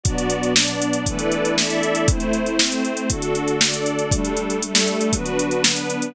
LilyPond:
<<
  \new Staff \with { instrumentName = "Pad 5 (bowed)" } { \time 4/4 \key g \major \tempo 4 = 118 <b, fis d'>2 <e a b d'>2 | <a c' e'>2 <d a fis'>2 | <g a d'>2 <d fis b>2 | }
  \new Staff \with { instrumentName = "String Ensemble 1" } { \time 4/4 \key g \major <b fis' d''>4 <b d' d''>4 <e' a' b' d''>4 <e' a' d'' e''>4 | <a e' c''>4 <a c' c''>4 <d' fis' a'>4 <d' a' d''>4 | <g d' a'>4 <g a a'>4 <d' fis' b'>4 <b d' b'>4 | }
  \new DrumStaff \with { instrumentName = "Drums" } \drummode { \time 4/4 <hh bd>16 hh16 hh16 hh16 sn16 hh16 hh16 hh16 <hh bd>16 hh16 hh16 hh16 sn16 hh16 hh16 hh16 | <hh bd>16 hh16 hh16 hh16 sn16 hh16 hh16 hh16 <hh bd>16 hh16 hh16 hh16 sn16 hh16 hh16 hh16 | <hh bd>16 hh16 hh16 hh16 hh16 sn16 hh16 hh16 <hh bd>16 hh16 hh16 hh16 sn16 hh16 hh16 hh16 | }
>>